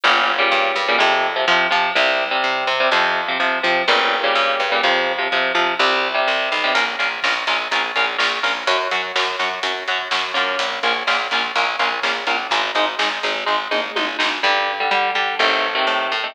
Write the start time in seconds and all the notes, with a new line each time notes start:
0.04 G1 A#2 C#3 G3
0.39 A#2 C#3 G3
0.52 G2
0.76 G2
0.88 A#2 C#3 G3
0.98 F2 C3 F3
1.36 C3 F3
1.48 C3 F3
1.71 C3 F3
1.95 C2 C3 G3
2.31 C3 G3
2.44 C3
2.67 C3
2.80 C3 G3
2.92 F2 C3 F3
3.28 C3 F3
3.40 C3 F3
3.63 C3 F3
3.88 G1 A#2 C#3 G3
4.24 A#2 C#3 G3
4.35 G2
4.60 G2
4.72 A#2 C#3 G3
4.83 F2 C3 F3
5.18 C3 F3
5.32 C3 F3
5.55 C3 F3
5.79 C2 C3 G3
6.14 C3 G3
6.28 C2
6.52 B1
6.64 C3 G3
6.75 A#1 C#4 F4 A#4, kick, closed hi-hat
6.87 kick
6.99 A#1 C#4 F4 A#4, kick, closed hi-hat
7.12 kick
7.23 A#1 C#4 F4 A#4, kick, snare
7.36 kick
7.47 A#1 C#4 F4 A#4, kick, snare, closed hi-hat
7.59 kick
7.71 A#1 C#4 F4 A#4, kick, closed hi-hat
7.84 kick
7.96 A#1 C#4 F4 A#4, kick, closed hi-hat
8.07 kick
8.18 A#1 C#4 F4 A#4, kick, snare
8.31 kick
8.43 A#1 C#4 F4 A#4, kick, open hi-hat
8.56 kick
8.67 F#2 C#4 F#4, kick, closed hi-hat
8.80 kick
8.91 F#2 C#4 F#4, kick, closed hi-hat
9.04 kick
9.15 F#2 C#4 F#4, kick, snare
9.28 kick
9.39 F#2 C#4 F#4, kick, snare, closed hi-hat
9.51 kick
9.63 F#2 C#4 F#4, kick, closed hi-hat
9.76 kick
9.88 F#2 C#4 F#4, kick, closed hi-hat
9.99 kick
10.11 F#2 C#4 F#4, kick, snare
10.23 kick
10.34 F#2 A#3 C#4 F4, kick, closed hi-hat
10.48 kick
10.59 A#1, kick, closed hi-hat
10.72 kick
10.83 A#1 A#3 C#4 F4, kick, closed hi-hat
10.95 kick
11.07 A#1 A#3 C#4 F4, kick, snare
11.19 kick
11.31 A#1 A#3 C#4 F4, kick, snare, closed hi-hat
11.43 kick
11.55 A#1 A#3 C#4 F4, kick, closed hi-hat
11.67 kick
11.79 A#1 A#3 C#4 F4, kick, closed hi-hat
11.92 kick
12.03 A#1 A#3 C#4 F4, kick, snare
12.15 kick
12.27 A#1 A#3 C#4 F4, kick, closed hi-hat
12.39 kick
12.51 G#1 G#3 D#4, kick, closed hi-hat
12.64 kick
12.75 G#1 G#3 D#4, kick, closed hi-hat
12.87 kick
12.99 G#1 G#3 D#4, kick, snare
13.11 kick
13.23 G#1 G#3 D#4, kick, snare, closed hi-hat
13.36 kick
13.46 G#1 G#3 D#4, kick
13.71 G#1 G#3 D#4, mid tom
13.96 G#1 G#3 D#4, high tom
14.19 G#1 G#3 D#4, snare
14.43 G2 D3 G3
14.80 D3 G3
14.91 D3 G3
15.15 D3 G3
15.39 A1 C3 D#3 A3
15.75 C3 D#3 A3
15.87 A2
16.12 A2
16.24 C3 D#3 A3